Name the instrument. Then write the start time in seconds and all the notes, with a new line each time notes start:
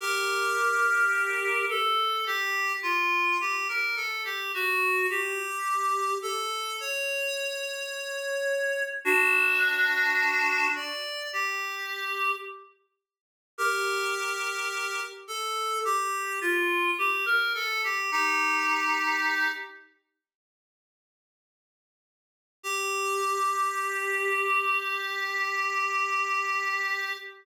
clarinet
0.00 G4 A#4
1.70 A4
2.26 G4
2.83 F4
3.41 G4
3.68 A#4
3.96 A4
4.25 G4
4.54 F#4
5.10 G4
6.22 A4
6.80 C#5
9.05 D4 F#4
10.75 D5
11.33 G4
13.58 G4 A#4
15.28 A4
15.85 G4
16.41 F4
16.98 G4
17.26 A#4
17.54 A4
17.84 G4
18.12 D#4 G4
22.63 G4